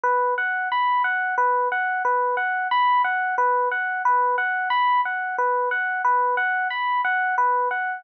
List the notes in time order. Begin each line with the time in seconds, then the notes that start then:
0.04 B4
0.38 F#5
0.72 B5
1.04 F#5
1.38 B4
1.72 F#5
2.05 B4
2.37 F#5
2.71 B5
3.04 F#5
3.38 B4
3.72 F#5
4.05 B4
4.38 F#5
4.70 B5
5.05 F#5
5.38 B4
5.71 F#5
6.05 B4
6.37 F#5
6.70 B5
7.05 F#5
7.38 B4
7.71 F#5